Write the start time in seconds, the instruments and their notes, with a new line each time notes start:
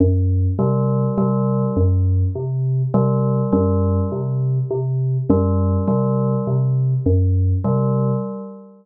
0.00 electric piano 2 F#2
0.59 electric piano 2 C3, tubular bells G3
1.17 electric piano 2 C3, tubular bells G3
1.76 electric piano 2 F#2
2.35 electric piano 2 C3
2.94 electric piano 2 C3, tubular bells G3
3.52 electric piano 2 F#2, tubular bells G3
4.12 electric piano 2 C3
4.71 electric piano 2 C3
5.29 electric piano 2 F#2, tubular bells G3
5.88 electric piano 2 C3, tubular bells G3
6.47 electric piano 2 C3
7.06 electric piano 2 F#2
7.64 electric piano 2 C3, tubular bells G3